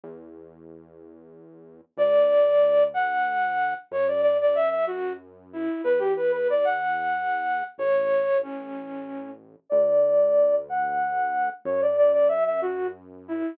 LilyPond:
<<
  \new Staff \with { instrumentName = "Flute" } { \time 6/8 \key d \major \tempo 4. = 62 r2. | d''4. fis''4. | cis''16 d''16 d''16 d''16 e''16 e''16 fis'8 r8 e'8 | b'16 g'16 b'16 b'16 d''16 fis''4.~ fis''16 |
cis''4 cis'4. r8 | d''4. fis''4. | cis''16 d''16 d''16 d''16 e''16 e''16 fis'8 r8 e'8 | }
  \new Staff \with { instrumentName = "Synth Bass 1" } { \clef bass \time 6/8 \key d \major e,2. | d,2. | fis,2. | e,2. |
a,,2. | d,2. | fis,2. | }
>>